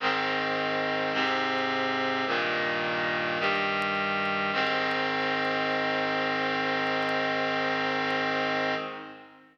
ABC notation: X:1
M:4/4
L:1/8
Q:1/4=53
K:Ab
V:1 name="Clarinet"
[A,,E,C]2 [A,,C,C]2 [G,,B,,E,]2 [G,,E,G,]2 | [A,,E,C]8 |]